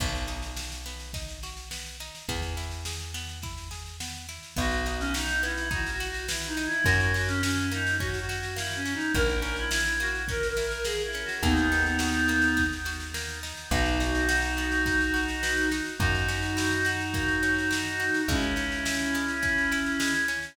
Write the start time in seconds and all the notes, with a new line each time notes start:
0.00 B1 B3, kick, snare, crash
0.15 snare
0.27 D#4, snare
0.42 snare
0.57 F#4, snare
0.72 snare
0.86 B3, snare
1.00 snare
1.13 D#4, kick, snare
1.29 snare
1.43 F#4, snare
1.57 snare
1.71 B3, snare
1.86 snare
2.00 D#4, snare
2.15 snare
2.29 E2 B3, kick, snare
2.42 snare
2.57 E4, snare
2.71 snare
2.85 G#4, snare
3.00 snare
3.14 B3, snare
3.29 snare
3.42 E4, kick, snare
3.58 snare
3.71 G#4, snare
3.86 snare
4.00 B3, snare
4.15 snare
4.29 E4, snare
4.43 snare
4.56 B1 B3 F#4, kick, snare
4.71 snare
4.86 D#4 F#4, snare
5.00 C#4, snare
5.14 D#4 F#4, snare
5.29 snare
5.43 B3 E4, snare
5.58 snare
5.71 D#4 F#4, kick, snare
5.87 snare
5.91 F#4
6.00 F#4, snare
6.09 F#4
6.14 snare
6.28 B3 E4, snare
6.42 snare
6.47 D#4
6.57 D#4, snare
6.66 E4
6.72 snare
6.84 F#2 A#3 F#4, kick, snare
7.00 snare
7.14 C#4 F#4, snare
7.28 C#4, snare
7.43 C#4 F#4, snare
7.57 snare
7.71 A#3 D#4, snare
7.87 snare
8.00 C#4 F#4, kick, snare
8.14 snare
8.19 F#4
8.29 F#4, snare
8.38 F#4
8.43 snare
8.56 A#3 E4, snare
8.71 snare
8.75 C#4
8.85 C#4, snare
8.94 D#4
9.00 snare
9.15 A#1 A#3 A#4, kick, snare
9.29 snare
9.42 C#4 A#4, snare
9.56 E4, snare
9.70 E4, snare
9.85 snare
10.00 A#3 F#4, snare
10.15 snare
10.28 C#4 A#4, kick, snare
10.43 snare
10.49 A#4
10.57 E4, snare
10.67 A#4
10.71 snare
10.84 A#3 G#4, snare
11.00 snare
11.05 E4
11.13 C#4, snare
11.25 F#4, snare
11.43 D#2 A#3 B3 D#4, kick, snare
11.57 snare
11.72 D#4, snare
11.86 snare
11.99 F#4, snare
12.14 snare
12.28 A#3, snare
12.42 snare
12.57 D#4, kick, snare
12.73 snare
12.85 F#4, snare
13.00 snare
13.14 A#3, snare
13.28 snare
13.43 D#4, snare
13.57 snare
13.71 B1 B3 D#4 F#4, kick, snare
13.86 snare
14.00 D#4, snare
14.15 snare
14.29 F#4, snare
14.42 snare
14.57 B3, snare
14.72 snare
14.86 D#4, kick, snare
15.01 snare
15.14 F#4, snare
15.28 snare
15.43 B3, snare
15.57 snare
15.71 D#4, snare
15.86 snare
15.98 F#2 A#3 D#4 F#4, kick, snare
16.15 snare
16.28 C#4, snare
16.43 snare
16.57 E4, snare
16.71 snare
16.85 F#4, snare
17.01 snare
17.14 A#3, kick, snare
17.28 snare
17.43 C#4, snare
17.58 snare
17.71 E4, snare
17.86 snare
18.00 F#4, snare
18.14 snare
18.28 C#2 G#3 C#4 E4, kick, snare
18.42 snare
18.56 C#4, snare
18.72 snare
18.85 E4, snare
18.99 snare
19.15 G#3, snare
19.28 snare
19.42 C#4, kick, snare
19.58 snare
19.72 E4, snare
19.86 snare
20.00 G#3, snare
20.14 snare
20.28 C#4, snare
20.42 snare